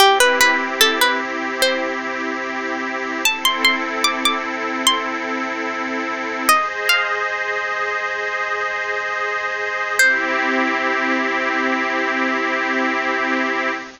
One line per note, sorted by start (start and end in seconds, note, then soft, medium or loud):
0.00 3.22 C4 medium
0.00 3.22 E4 medium
0.00 0.18 G4 loud
0.00 3.22 G4 medium
0.20 0.40 B4 medium
0.41 0.78 B4 medium
0.81 1.00 A4 medium
1.01 1.21 B4 medium
1.62 3.09 C5 medium
3.25 6.46 C4 medium
3.25 6.46 E4 medium
3.25 6.46 A4 medium
3.25 3.45 A5 loud
3.45 3.64 C6 medium
3.65 4.04 C6 medium
4.04 4.23 D6 medium
4.25 4.45 D6 medium
4.87 6.27 C6 loud
6.49 9.96 G#4 medium
6.49 9.96 C5 medium
6.49 6.68 D#5 medium
6.49 9.96 D#5 medium
6.89 8.35 F5 medium
9.98 13.70 C4 loud
9.98 13.70 E4 medium
9.98 13.70 G4 loud
9.98 13.71 C5 loud